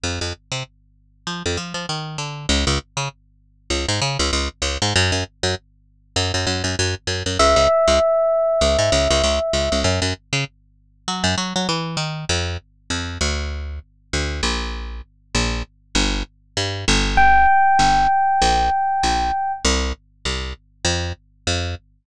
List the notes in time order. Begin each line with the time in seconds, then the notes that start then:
0.04 F2
0.21 F2
0.52 C3
1.27 F3
1.46 F2
1.57 F3
1.74 F3
1.89 D#3
2.18 D3
2.49 C#2
2.67 C#2
2.97 C#3
3.70 C#2
3.89 G#2
4.02 C#3
4.19 C#2
4.33 C#2
4.62 C#2
4.82 G#2
4.96 F#2
5.12 F#2
5.43 F#2
6.16 F#2
6.34 F#2
6.47 F#2
6.64 F#2
6.79 F#2
7.07 F#2
7.26 F#2
7.39 C#2 E5
7.56 C#2
7.88 C#2
8.61 C#2
8.79 G#2
8.92 C#2
9.10 C#2
9.24 C#2
9.53 C#2
9.72 C#2
9.84 F#2
10.02 F#2
10.33 C#3
11.08 F#3
11.24 F#2
11.38 F#3
11.56 F#3
11.69 E3
11.97 D#3
12.29 F2
12.90 F2
13.21 D2
14.13 D2
14.43 A#1
15.35 A#1
15.95 G1
16.57 G2
16.88 G1
17.17 G5
17.79 G1
18.42 A#1
19.03 A#1
19.65 C2
20.25 C2
20.85 F2
21.47 F2